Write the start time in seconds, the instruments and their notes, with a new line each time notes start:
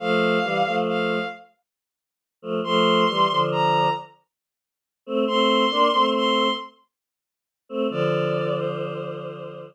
0.00 choir aahs F3 A3, violin F5
0.43 choir aahs E3 G3
0.66 choir aahs F3 A3
0.88 violin F5
2.42 choir aahs F3 A3
2.64 choir aahs F3 A3, violin C6
3.09 choir aahs E3 G3
3.30 choir aahs D3 F3
3.52 violin A#5
5.06 choir aahs A3 C4
5.27 choir aahs A3 C4, violin C6
5.71 choir aahs A#3 D4
5.93 choir aahs A3 C4
6.15 violin C6
7.69 choir aahs A3 C4
7.90 choir aahs D3 F3, violin D5
8.57 violin C5